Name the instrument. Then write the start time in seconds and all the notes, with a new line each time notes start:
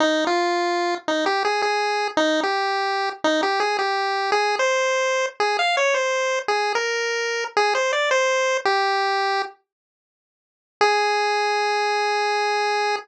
lead 1 (square)
0.00 D#4
0.27 F4
1.08 D#4
1.26 G4
1.45 G#4
1.62 G#4
2.17 D#4
2.43 G4
3.24 D#4
3.43 G4
3.60 G#4
3.79 G4
4.32 G#4
4.59 C5
5.40 G#4
5.59 F5
5.77 C#5
5.94 C5
6.48 G#4
6.75 A#4
7.57 G#4
7.75 C5
7.93 D5
8.11 C5
8.65 G4
10.81 G#4